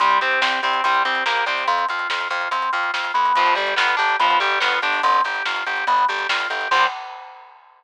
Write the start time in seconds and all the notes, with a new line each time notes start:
0.00 C2 G3 C4, kick, closed hi-hat
0.10 closed hi-hat
0.21 C2 C4 G4, closed hi-hat
0.31 closed hi-hat
0.41 C2 C4 G4, snare
0.52 closed hi-hat
0.63 C2 C4 G4, closed hi-hat
0.73 kick, closed hi-hat
0.84 C2 G3 C4, kick, closed hi-hat
0.94 closed hi-hat
1.05 C2 C4 G4, closed hi-hat
1.15 closed hi-hat
1.26 C2 A#3 G4, snare
1.36 closed hi-hat
1.46 C2 C4 G4, closed hi-hat
1.57 open hi-hat
1.67 F2 C4, kick, closed hi-hat
1.78 closed hi-hat
1.89 F2 F4, closed hi-hat
1.99 closed hi-hat
2.09 F2 F4, snare
2.21 closed hi-hat
2.30 F2 F4, closed hi-hat
2.41 closed hi-hat
2.51 F2 C4, kick, closed hi-hat
2.62 closed hi-hat
2.73 F2 F4, closed hi-hat
2.83 closed hi-hat
2.93 F2 F4, snare
3.04 closed hi-hat
3.14 F2 B3, closed hi-hat
3.25 closed hi-hat
3.36 G1 F3, kick, closed hi-hat
3.46 closed hi-hat
3.55 G1 G3 G4, closed hi-hat
3.67 closed hi-hat
3.76 G1 B3 F4, snare
3.88 closed hi-hat
3.97 G1 D4 G4, closed hi-hat
4.09 kick, closed hi-hat
4.19 G1 F3 B3, kick, closed hi-hat
4.30 closed hi-hat
4.40 G1 G3 G4, closed hi-hat
4.51 closed hi-hat
4.60 G1 B3 F4, snare
4.72 closed hi-hat
4.82 G1 D4 G4, closed hi-hat
4.93 open hi-hat
5.03 G1 C4, kick, closed hi-hat
5.14 closed hi-hat
5.24 G1 G4, closed hi-hat
5.35 closed hi-hat
5.45 G1 F4, snare
5.56 closed hi-hat
5.66 G1 G4, closed hi-hat
5.77 closed hi-hat
5.87 G1 B3, kick, closed hi-hat
5.98 closed hi-hat
6.09 G1 G4, closed hi-hat
6.19 closed hi-hat
6.29 G1 F4, snare
6.40 closed hi-hat
6.50 G1 G4, closed hi-hat
6.61 closed hi-hat
6.71 C2 G3 C4 G4, kick, crash